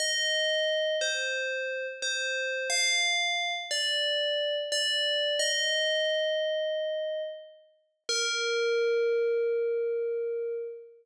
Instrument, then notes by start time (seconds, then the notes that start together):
tubular bells
0.00 D#5
1.01 C5
2.02 C5
2.70 F5
3.71 D5
4.72 D5
5.39 D#5
8.09 A#4